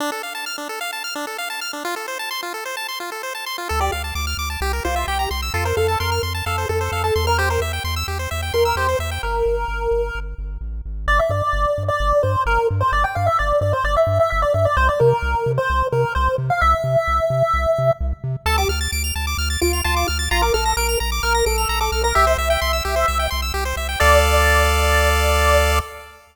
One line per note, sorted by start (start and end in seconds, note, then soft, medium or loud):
0.00 0.11 D4 loud
0.12 0.22 A4 medium
0.23 0.34 F5 medium
0.35 0.45 A5 medium
0.46 0.57 F6 medium
0.58 0.68 D4 medium
0.69 0.80 A4 medium
0.81 0.91 F5 medium
0.93 1.03 A5 medium
1.04 1.14 F6 medium
1.15 1.26 D4 medium
1.27 1.37 A4 medium
1.38 1.49 F5 medium
1.50 1.60 A5 medium
1.61 1.72 F6 medium
1.73 1.83 D4 medium
1.85 1.95 F4 medium
1.96 2.07 A4 medium
2.08 2.18 C5 medium
2.19 2.30 A5 medium
2.31 2.41 C6 medium
2.43 2.53 F4 medium
2.54 2.64 A4 medium
2.65 2.76 C5 medium
2.77 2.87 A5 medium
2.88 2.99 C6 medium
3.00 3.10 F4 medium
3.12 3.22 A4 medium
3.23 3.33 C5 medium
3.35 3.45 A5 medium
3.46 3.57 C6 medium
3.58 3.68 F4 medium
3.69 3.90 D2 medium
3.69 3.80 A4 medium
3.80 3.91 G4 medium
3.80 3.91 D5 medium
3.92 4.12 D2 medium
3.92 4.02 F5 medium
4.04 4.14 A5 medium
4.15 4.35 D2 medium
4.15 4.26 D6 medium
4.27 4.37 F6 medium
4.37 4.57 D2 medium
4.37 4.49 D6 medium
4.50 4.60 A5 medium
4.61 4.80 C2 medium
4.61 4.72 G4 medium
4.73 4.83 A#4 medium
4.85 5.05 C2 medium
4.85 5.06 F4 medium
4.85 4.95 C5 medium
4.96 5.06 E5 medium
5.07 5.27 C2 medium
5.07 5.29 G4 medium
5.07 5.18 G5 medium
5.19 5.29 A#5 medium
5.31 5.50 C2 medium
5.31 5.41 C6 medium
5.42 5.53 E6 medium
5.54 5.73 F2 medium
5.54 5.65 F4 medium
5.54 5.64 A4 medium
5.65 5.76 A#4 medium
5.65 5.76 C5 medium
5.77 5.97 F2 medium
5.77 5.98 A4 medium
5.77 5.87 F5 medium
5.88 5.99 A5 medium
6.00 6.20 F2 medium
6.00 6.22 A#4 medium
6.00 6.10 C6 medium
6.12 6.22 F6 medium
6.23 6.42 F2 medium
6.23 6.33 C6 medium
6.35 6.45 A5 medium
6.46 6.66 F2 medium
6.46 6.66 A4 medium
6.46 6.57 F5 medium
6.58 6.68 C5 medium
6.69 6.89 F2 medium
6.69 6.80 A4 medium
6.69 7.02 A4 medium
6.81 6.91 C5 medium
6.92 7.11 F2 medium
6.92 7.03 F5 medium
7.04 7.25 A4 medium
7.04 7.14 A5 medium
7.16 7.58 E2 medium
7.16 7.26 C6 medium
7.27 7.38 A#4 medium
7.27 7.37 F6 medium
7.38 7.49 G4 medium
7.38 7.49 C5 medium
7.50 7.61 A#4 medium
7.50 7.60 C5 medium
7.60 7.80 E2 medium
7.60 7.72 E5 medium
7.73 7.83 G5 medium
7.84 8.04 E2 medium
7.84 7.95 C6 medium
7.96 8.07 E6 medium
8.08 8.27 E2 medium
8.08 8.18 G4 medium
8.19 8.30 C5 medium
8.31 8.51 E2 medium
8.31 8.41 E5 medium
8.42 8.53 G5 medium
8.54 8.73 E2 soft
8.54 8.75 A#4 medium
8.54 8.64 C6 medium
8.65 8.76 E6 medium
8.76 8.95 E2 medium
8.76 8.87 G4 medium
8.76 8.97 C5 medium
8.89 8.99 C5 medium
8.99 9.19 E2 medium
8.99 9.10 E5 medium
9.11 9.22 G5 medium
9.23 9.43 G1 medium
9.23 10.19 A#4 medium
9.46 9.65 G1 medium
9.68 9.88 G1 medium
9.91 10.11 G1 medium
10.15 10.35 G1 medium
10.38 10.58 G1 medium
10.61 10.82 A1 medium
10.85 11.06 G#1 medium
11.08 11.20 G1 loud
11.08 11.19 D5 loud
11.19 11.30 E5 medium
11.30 11.42 G2 medium
11.30 11.83 D5 medium
11.53 11.66 G1 medium
11.78 11.91 G2 medium
11.88 12.22 D5 medium
12.00 12.13 G1 medium
12.23 12.36 G2 medium
12.23 12.43 C5 medium
12.46 12.58 G1 medium
12.46 12.67 A#4 medium
12.71 12.83 G2 medium
12.81 12.92 C5 medium
12.92 13.05 G1 medium
12.92 13.04 D5 medium
13.04 13.15 G5 medium
13.15 13.29 G2 medium
13.15 13.26 F5 loud
13.26 13.37 E5 medium
13.39 13.53 G1 medium
13.39 13.60 D5 medium
13.61 13.74 G2 medium
13.61 13.72 D5 medium
13.73 13.84 C5 medium
13.84 13.97 G1 medium
13.84 13.95 D5 medium
13.97 14.18 E5 medium
14.07 14.20 G2 medium
14.20 14.30 E5 medium
14.30 14.45 G1 medium
14.30 14.41 E5 medium
14.42 14.53 D5 medium
14.54 14.67 G2 medium
14.54 14.65 E5 medium
14.65 14.76 D5 medium
14.77 14.90 C2 loud
14.77 14.88 C5 loud
14.89 15.00 D5 medium
15.00 15.13 C3 medium
15.00 15.51 A#4 medium
15.22 15.35 C2 medium
15.46 15.59 C3 medium
15.58 15.87 C5 medium
15.70 15.82 C2 medium
15.92 16.05 C3 medium
15.92 16.13 A#4 medium
16.15 16.29 C2 medium
16.15 16.35 C5 medium
16.38 16.51 C3 medium
16.50 16.61 F5 medium
16.61 16.75 C2 medium
16.61 17.92 E5 loud
16.84 16.97 C3 medium
17.08 17.20 C2 medium
17.30 17.43 C3 medium
17.54 17.66 C2 medium
17.78 17.91 C3 medium
18.01 18.13 C2 medium
18.24 18.36 C3 medium
18.46 18.65 D2 medium
18.46 18.57 A4 loud
18.46 18.57 A5 loud
18.58 18.69 G4 medium
18.58 18.68 D6 medium
18.69 18.88 D2 medium
18.69 18.80 F6 medium
18.81 18.91 A6 medium
18.92 19.12 D2 medium
18.92 19.03 D7 medium
19.04 19.14 F7 medium
19.15 19.35 D2 medium
19.15 19.26 A5 medium
19.27 19.37 D6 medium
19.38 19.57 D2 medium
19.38 19.49 F6 medium
19.50 19.60 A6 medium
19.61 19.82 D2 medium
19.61 19.80 F4 medium
19.61 19.72 D7 medium
19.73 19.83 F7 medium
19.84 20.05 D2 medium
19.84 20.07 F4 medium
19.84 19.95 A5 loud
19.96 20.07 D6 medium
20.08 20.28 D2 medium
20.08 20.18 F6 medium
20.19 20.29 A6 medium
20.31 20.51 A#1 medium
20.31 20.42 F4 loud
20.31 20.41 A#5 loud
20.42 20.53 A#4 medium
20.42 20.53 D6 medium
20.54 20.74 A#1 medium
20.54 20.73 A4 medium
20.54 20.64 F6 medium
20.66 20.76 A#6 medium
20.77 20.96 A#1 medium
20.77 20.98 A#4 medium
20.77 20.87 D7 medium
20.89 20.99 F7 medium
21.00 21.20 A#1 medium
21.00 21.10 A#5 medium
21.12 21.22 D6 medium
21.23 21.43 A#1 medium
21.23 21.45 A#4 medium
21.23 21.33 F6 medium
21.35 21.45 A#6 medium
21.46 21.66 A#1 medium
21.46 21.78 A4 medium
21.46 21.57 D7 medium
21.58 21.68 F7 medium
21.69 21.90 A#1 medium
21.69 21.80 A#5 medium
21.81 22.02 A4 medium
21.81 21.91 D6 medium
21.92 22.13 B1 medium
21.92 22.03 F6 medium
22.04 22.15 A#4 medium
22.04 22.14 A#6 medium
22.15 22.36 C2 medium
22.15 22.26 G4 loud
22.15 23.26 E5 loud
22.27 22.37 C5 medium
22.38 22.57 C2 medium
22.38 22.49 E5 medium
22.50 22.60 G5 medium
22.62 22.81 C2 medium
22.62 22.72 C6 medium
22.73 22.83 E6 medium
22.85 23.05 C2 medium
22.85 22.95 G4 medium
22.96 23.06 C5 medium
23.08 23.28 C2 medium
23.08 23.18 E5 medium
23.19 23.30 G5 medium
23.30 23.52 C2 medium
23.30 23.41 C6 medium
23.42 23.53 E6 medium
23.54 23.74 C2 medium
23.54 23.64 G4 medium
23.65 23.76 C5 medium
23.76 23.96 C2 medium
23.76 23.88 E5 medium
23.89 23.99 G5 medium
24.00 25.80 D2 loud
24.00 25.79 A4 loud
24.00 25.79 D5 loud
24.00 25.79 D5 medium
24.00 25.79 F5 medium